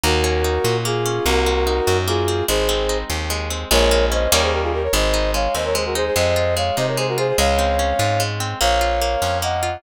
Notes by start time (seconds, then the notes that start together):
0.03 D#2 A#3 F#4 A#4
0.24 C#4
0.44 D#4
0.64 A#2 F#4
0.85 A#3 F4 G#4
1.06 C#4
1.26 C2 A#3 F#4 A#4
1.46 C4
1.67 D#4
1.87 F#2 F#4
2.08 A#3 F4 G#4
2.28 C4
2.48 G#1 G#3 G#4 C5
2.69 C4
2.89 D#4
3.10 D#2 G4
3.30 G#3
3.50 C4
3.71 A#1 G#3 A#4 C#5
3.91 A#3
4.12 C#4 C5 D#5
4.32 D#2 G3 A#3 C#4 D#4 A#4 C#5
4.42 G#4 C5
4.52 G4 A#4
4.63 F4 G#4
4.73 G4 A#4
4.83 A#4 C#5
4.93 G#1 G#3 C5 D#5
5.14 D#4
5.34 G#3 C#5 F5
5.55 D#2 C4 C5 D#5
5.65 A#4 C#5
5.75 G#3 G#4 C5
5.85 F#4 A#4
5.95 D#4 G#4 C5
6.06 G#4 C5
6.16 F2 G#3 C5 D#5
6.36 F4
6.57 G#3 C#5 F5
6.77 C3 D#4 C5 D#5
6.87 A#4 C#5
6.97 G#3 G#4 C5
7.08 F#4 A#4
7.18 F4 G#4 C5
7.28 G#4 C5
7.38 C#2 G#3 C#5 F5
7.59 C4
7.79 C#4
7.99 G#2 F4
8.20 G#3
8.40 C4
8.61 A#1 A#3 C#5 F5
8.81 F4
9.01 A#3
9.22 F2 C#4
9.42 A#3 D#5 F#5
9.63 F4